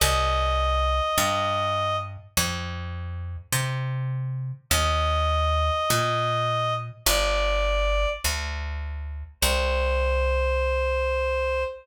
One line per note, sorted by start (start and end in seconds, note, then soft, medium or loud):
0.00 1.01 C2 loud
0.00 1.96 D#5 loud
1.18 2.17 G2 loud
2.37 3.36 F2 loud
3.52 4.52 C3 loud
4.70 5.70 D#2 loud
4.70 6.74 D#5 loud
5.90 6.89 A#2 loud
7.06 8.06 G1 loud
7.06 8.09 D5 loud
8.24 9.24 D2 medium
9.41 11.64 C2 loud
9.41 11.63 C5 loud